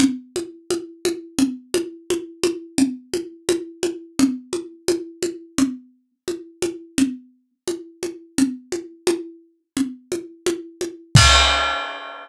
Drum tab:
CC |----|----|----|----|
CG |Oooo|Oooo|Oooo|Oooo|
BD |----|----|----|----|

CC |----|----|----|----|
CG |O-oo|O-oo|Ooo-|Oooo|
BD |----|----|----|----|

CC |x---|
CG |----|
BD |o---|